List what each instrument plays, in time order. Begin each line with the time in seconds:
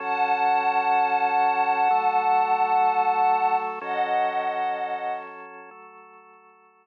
0.00 drawbar organ F#3 C#4 A4, pad 5 (bowed) F#5 A5
1.90 drawbar organ F#3 A3 A4
3.81 drawbar organ F#3 C#4 A4, pad 5 (bowed) D#5 F#5
5.71 drawbar organ F#3 A3 A4